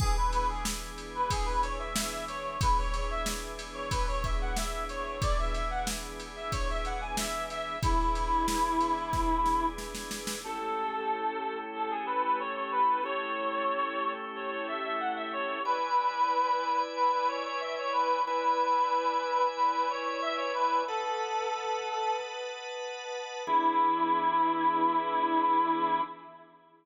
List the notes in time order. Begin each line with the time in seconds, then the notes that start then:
0.00 E3 B3 D4 G#4, kick, crash
0.17 B4
0.32 B4, ride
0.49 G#4
0.65 snare
0.98 ride
1.15 B4
1.30 G#4, kick, ride
1.45 B4
1.63 C#5, ride
1.79 E5
1.96 E5, snare
2.28 C#5, ride
2.61 E3 B3 D4 G#4 B4, kick, ride
2.78 C#5
2.94 C#5, ride
3.10 E5
3.26 snare
3.59 ride
3.74 C#5
3.91 B4, kick, ride
4.08 C#5
4.24 E5, kick, ride
4.41 F#5
4.56 E5, snare
4.89 C#5, ride
5.21 E3 B3 D4 G#4 D5, kick, ride
5.39 E5
5.53 E5, ride
5.70 F#5
5.87 snare
6.20 ride
6.36 E5
6.52 C#5, kick, ride
6.70 E5
6.85 F#5, ride
7.01 G#5
7.17 E5, snare
7.50 E5, ride
7.83 E3 B3 D4 E4 G#4, kick, ride
8.15 ride
8.48 snare
8.80 ride
9.13 kick, snare
9.46 snare
9.78 snare
9.95 snare
10.11 snare
10.27 snare
10.44 A3 C#4 E4 G4 A4
11.75 A4
11.91 G#4
12.06 B4
12.24 B4
12.40 C#5
12.55 C#5
12.72 B4
13.03 A3 C#4 E4 G4 C#5
14.36 C#5
14.51 C#5
14.68 E5
14.84 E5
15.00 F#5
15.16 E5
15.33 C#5
15.65 E4 B4 D5 G#5
16.96 B4
17.12 B4
17.28 C#5
17.45 C#5
17.60 E5
17.78 C#5
17.93 B4
18.25 E4 B4 D5 G#5
19.56 B4
19.73 B4
19.90 C#5
20.05 C#5
20.22 E5
20.37 C#5
20.54 B4
20.87 A4 B4 D#5 F#5 A5
23.47 E3 B3 D4 E4 G#4